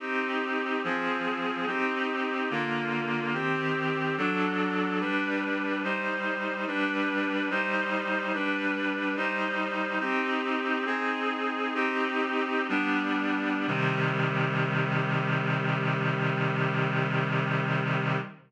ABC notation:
X:1
M:4/4
L:1/8
Q:1/4=72
K:Cm
V:1 name="Clarinet"
[CEG]2 [F,CA]2 [CEG]2 [D,B,F]2 | [E,CG]2 [^F,D=A]2 [G,D=B]2 [G,Ec]2 | [G,D=B]2 [G,Ec]2 [G,DB]2 [G,Ec]2 | "^rit." [CEG]2 [CEA]2 [CEG]2 [G,=B,D]2 |
[C,E,G,]8 |]